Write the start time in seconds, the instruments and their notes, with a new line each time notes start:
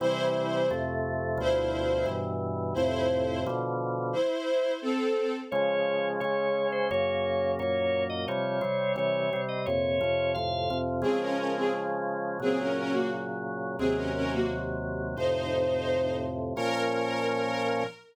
0.00 drawbar organ C3 E3 G3, string ensemble 1 E4 C5
0.71 drawbar organ F2 C3 A3
1.38 drawbar organ D2 B2 F3, string ensemble 1 E4 C5
2.06 drawbar organ G2 B2 E3
2.74 drawbar organ F2 A2 C3, string ensemble 1 E4 C5
3.46 drawbar organ B2 D3 F3
4.13 string ensemble 1 E4 C5
4.82 string ensemble 1 C4 A4
5.51 drawbar organ C#3 F3 G#3 C#5
6.20 drawbar organ C#3 G#3 C#4 C#5
6.72 drawbar organ C5
6.91 drawbar organ F#2 C#3 A#3 C#5
7.59 drawbar organ F#2 A#2 A#3 C#5
8.10 drawbar organ D#5
8.28 drawbar organ C3 F3 G3 C#5
8.61 drawbar organ C3 G3 C4
8.96 drawbar organ C3 E3 G3 C#5
9.33 drawbar organ C3 G3 C4
9.48 drawbar organ D#5
9.66 drawbar organ F2 A#2 C3 C#5
10.01 drawbar organ F2 C3 F3
10.34 drawbar organ F2 A2 C3 F5
10.70 drawbar organ F2 C3 F3
11.02 drawbar organ C#3 F3 G#3, string ensemble 1 C4 G#4
11.21 string ensemble 1 C#4 A#4
11.38 string ensemble 1 C#4 A#4
11.55 string ensemble 1 C4 G#4
12.40 drawbar organ A#2 C#3 F#3, string ensemble 1 C4 G#4
12.60 string ensemble 1 C#4 A#4
12.76 string ensemble 1 C#4 A#4
12.92 string ensemble 1 A#3 F#4
13.79 drawbar organ D#2 C3 F#3, string ensemble 1 C4 G#4
13.95 string ensemble 1 C#4 A#4
14.14 string ensemble 1 C#4 A#4
14.32 string ensemble 1 A#3 F#4
15.16 drawbar organ F2 A2 C3, string ensemble 1 D#4 C5
16.56 drawbar organ A#2 F3 C#4, string ensemble 1 A#4